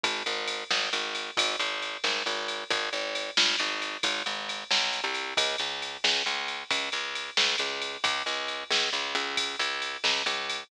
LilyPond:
<<
  \new Staff \with { instrumentName = "Electric Bass (finger)" } { \clef bass \time 12/8 \key aes \major \tempo 4. = 90 aes,,8 aes,,4 aes,,8 aes,,4 aes,,8 aes,,4 aes,,8 aes,,4 | aes,,8 aes,,4 aes,,8 aes,,4 aes,,8 aes,,4 b,,8. c,8. | des,8 des,4 des,8 des,4 des,8 des,4 des,8 des,4 | des,8 des,4 des,8 des,8 des,4 des,4 des,8 des,4 | }
  \new DrumStaff \with { instrumentName = "Drums" } \drummode { \time 12/8 <bd cymr>8 cymr8 cymr8 sn8 cymr8 cymr8 <bd cymr>8 cymr8 cymr8 sn8 cymr8 cymr8 | <bd cymr>8 cymr8 cymr8 sn8 cymr8 cymr8 <bd cymr>8 cymr8 cymr8 sn8 cymr8 cymr8 | <bd cymr>8 cymr8 cymr8 sn8 cymr8 cymr8 <bd cymr>8 cymr8 cymr8 sn8 cymr8 cymr8 | <bd cymr>8 cymr8 cymr8 sn8 cymr8 cymr8 <bd cymr>8 cymr8 cymr8 sn8 cymr8 cymr8 | }
>>